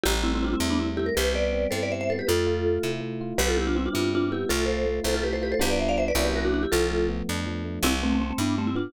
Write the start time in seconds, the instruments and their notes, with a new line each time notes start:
0.04 electric bass (finger) A1, electric piano 1 G3, vibraphone E4 G4
0.24 electric piano 1 A3, vibraphone C4 E4
0.35 vibraphone C4 E4
0.42 electric piano 1 C4, vibraphone D4 F4
0.53 vibraphone C4 E4
0.60 electric bass (finger) E2, electric piano 1 E4
0.70 vibraphone B3 D4
0.79 electric piano 1 G3, vibraphone C4 E4
0.97 electric piano 1 A3, vibraphone E4 G4
1.06 vibraphone A#4
1.15 electric bass (finger) C2, electric piano 1 G3, vibraphone G4 B4
1.34 electric piano 1 B3, vibraphone B4 D5
1.52 electric piano 1 C4
1.71 electric bass (finger) G2, electric piano 1 E4, vibraphone A4 C5
1.83 vibraphone B4 D5
1.90 electric piano 1 G3, vibraphone C5 E5
2.01 vibraphone C5 E5
2.10 electric piano 1 B3, vibraphone A4 C5
2.19 vibraphone G4 B4
2.27 electric bass (finger) F2, electric piano 1 A3, vibraphone F4 A4
2.47 electric piano 1 F4
2.65 electric piano 1 A3
2.83 electric bass (finger) C3, electric piano 1 E4
3.01 electric piano 1 A3
3.21 electric piano 1 F4
3.38 electric bass (finger) C2, electric piano 1 G3, vibraphone G4 B4
3.48 vibraphone F4 A4
3.57 electric piano 1 B3, vibraphone E4 G4
3.67 vibraphone D4 F4
3.75 electric piano 1 C4, vibraphone C4 E4
3.86 vibraphone D4 F4
3.93 electric bass (finger) G2, electric piano 1 E4
4.12 electric piano 1 G3, vibraphone D4 F4
4.31 electric piano 1 B3, vibraphone E4 G4
4.49 electric bass (finger) C2, electric piano 1 A3, vibraphone F4 A4
4.66 electric piano 1 F4, vibraphone A4 C5
4.86 electric piano 1 A3
5.04 electric bass (finger) C2, electric piano 1 E4, vibraphone A4 C5
5.14 vibraphone F4 A4
5.23 electric piano 1 A3, vibraphone G4 B4
5.33 vibraphone A4 C5
5.41 electric piano 1 F4, vibraphone G4 B4
5.52 vibraphone A4 C5
5.59 electric bass (finger) C2, electric piano 1 G3 B3 D4 F4, vibraphone G4 B4
5.70 vibraphone B4 D5
5.80 vibraphone C5 E5
5.89 vibraphone D5 F5
5.98 vibraphone C5 E5
6.08 vibraphone B4 D5
6.15 electric bass (finger) C2, electric piano 1 F#3 A#3 C#4 E4
6.25 vibraphone G4 B4
6.36 vibraphone F#4 A#4
6.45 vibraphone D4 F#4
6.54 vibraphone D4 F#4
6.63 vibraphone E4 G4
6.72 electric bass (finger) C2, electric piano 1 F3, vibraphone F4 A4
6.91 electric piano 1 A3
7.08 electric piano 1 B3
7.29 electric bass (finger) F2, electric piano 1 D4
7.46 electric piano 1 F3
7.65 electric piano 1 A3
7.82 electric bass (finger) C2, electric piano 1 G3, vibraphone C4 E4
8.02 vibraphone A3 C4, electric piano 1 B3
8.13 vibraphone A3 C4
8.19 vibraphone A3 C4, electric piano 1 C4
8.31 vibraphone A3 C4
8.38 electric bass (finger) G2, vibraphone B3 D4, electric piano 1 E4
8.58 electric piano 1 G3, vibraphone A3 C4
8.67 vibraphone C4 E4
8.75 electric piano 1 B3, vibraphone D4 F4